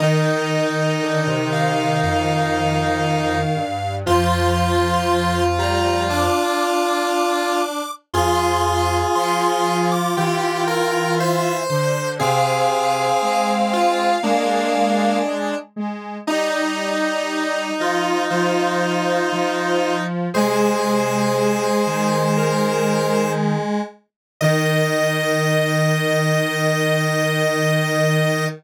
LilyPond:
<<
  \new Staff \with { instrumentName = "Lead 1 (square)" } { \time 4/4 \key ees \major \tempo 4 = 59 ees''4. f''8 f''2 | c'''4. bes''8 d'''2 | c'''4 c'''8. d'''16 g''4 e''8 c''8 | f''2. r4 |
ees''4. ees''8 c''2 | aes'2 bes'4 r4 | ees''1 | }
  \new Staff \with { instrumentName = "Lead 1 (square)" } { \time 4/4 \key ees \major ees'1 | f'1 | aes'2 g'8 bes'8 c''4 | aes'4. f'8 d'4. r8 |
ees'1 | c''2. r4 | ees''1 | }
  \new Staff \with { instrumentName = "Lead 1 (square)" } { \time 4/4 \key ees \major ees1 | f4. g8 d'2 | f'1 | c'2 bes4 r4 |
ees'4. f'8 f'2 | aes1 | ees1 | }
  \new Staff \with { instrumentName = "Lead 1 (square)" } { \clef bass \time 4/4 \key ees \major ees8 r8 d16 c8. f,4. g,8 | f,2~ f,8 r4. | f,4 f4 e4. d8 | c4 aes4 aes4. aes8 |
g4. f8 f4 f4 | c4. ees2 r8 | ees1 | }
>>